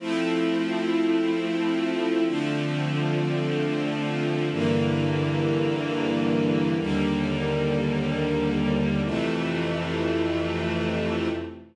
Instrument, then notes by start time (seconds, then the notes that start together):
string ensemble 1
0.00 F3 A3 C4 E4
2.26 D3 F3 A3 C4
4.52 G2 D3 E3 A#3
6.78 D#2 D3 G3 A#3
9.04 F2 C3 E3 A3